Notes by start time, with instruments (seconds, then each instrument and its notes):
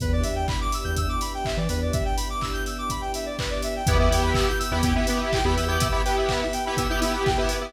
0.00 synth bass 2 E2, string ensemble 1 B3 D4 E4 G4, lead 1 (square) B4, kick, closed hi-hat
0.13 lead 1 (square) D5
0.23 synth bass 2 E2, lead 1 (square) E5, open hi-hat
0.36 lead 1 (square) G5
0.48 lead 1 (square) B5, kick, clap
0.61 lead 1 (square) D6
0.72 lead 1 (square) E6, open hi-hat
0.84 synth bass 2 E2, lead 1 (square) G6
0.96 lead 1 (square) E6, kick, closed hi-hat
1.09 lead 1 (square) D6
1.21 lead 1 (square) B5, open hi-hat
1.34 lead 1 (square) G5
1.45 lead 1 (square) E5, kick, clap
1.57 synth bass 2 E3, lead 1 (square) D5
1.69 synth bass 2 E2, lead 1 (square) B4, open hi-hat
1.82 lead 1 (square) D5
1.93 lead 1 (square) E5, kick, closed hi-hat
2.05 lead 1 (square) G5
2.17 lead 1 (square) B5, open hi-hat
2.30 lead 1 (square) D6
2.41 lead 1 (square) E6, kick, clap
2.53 lead 1 (square) G6
2.66 lead 1 (square) E6, open hi-hat
2.78 lead 1 (square) D6
2.90 lead 1 (square) B5, kick, closed hi-hat
3.01 lead 1 (square) G5
3.14 lead 1 (square) E5, open hi-hat
3.26 lead 1 (square) D5
3.39 lead 1 (square) B4, kick, clap
3.50 lead 1 (square) D5
3.62 lead 1 (square) E5, open hi-hat
3.76 lead 1 (square) G5
3.86 synth bass 2 E2, string ensemble 1 B3 E4 G4, lead 2 (sawtooth) B3 E4 G4, lead 1 (square) B4, kick, closed hi-hat
3.99 lead 2 (sawtooth) B3 E4 G4, lead 1 (square) E5
4.10 synth bass 2 E2, lead 2 (sawtooth) B3 E4 G4, lead 1 (square) G5, open hi-hat
4.23 lead 1 (square) B5
4.34 lead 1 (square) E6, kick, clap
4.48 lead 1 (square) G6
4.59 lead 1 (square) E6, open hi-hat
4.71 synth bass 2 E2, lead 2 (sawtooth) B3 E4 G4, lead 1 (square) B5
4.83 lead 2 (sawtooth) B3 E4 G4, lead 1 (square) G5, kick, closed hi-hat
4.95 lead 2 (sawtooth) B3 E4 G4, lead 1 (square) E5
5.07 lead 2 (sawtooth) B3 E4 G4, lead 1 (square) B4, open hi-hat
5.20 lead 1 (square) E5
5.33 lead 1 (square) G5, kick, clap
5.44 synth bass 2 E2, lead 2 (sawtooth) B3 E4 G4, lead 1 (square) B5
5.56 synth bass 2 E2, lead 1 (square) E6, open hi-hat
5.68 lead 2 (sawtooth) B3 E4 G4, lead 1 (square) G6
5.80 lead 1 (square) E6, kick, closed hi-hat
5.92 lead 2 (sawtooth) B3 E4 G4, lead 1 (square) B5
6.05 lead 2 (sawtooth) B3 E4 G4, lead 1 (square) G5, open hi-hat
6.17 lead 1 (square) E5
6.29 lead 1 (square) B4, kick, clap
6.42 lead 1 (square) E5
6.53 lead 1 (square) G5, open hi-hat
6.65 lead 2 (sawtooth) B3 E4 G4, lead 1 (square) B5
6.77 lead 2 (sawtooth) B3 E4 G4, lead 1 (square) E6, kick, closed hi-hat
6.89 lead 2 (sawtooth) B3 E4 G4, lead 1 (square) G6
7.01 lead 2 (sawtooth) B3 E4 G4, lead 1 (square) E6, open hi-hat
7.13 lead 1 (square) B5
7.26 lead 1 (square) G5, kick, clap
7.38 lead 2 (sawtooth) B3 E4 G4, lead 1 (square) E5
7.49 lead 1 (square) B4, open hi-hat
7.61 lead 2 (sawtooth) B3 E4 G4, lead 1 (square) E5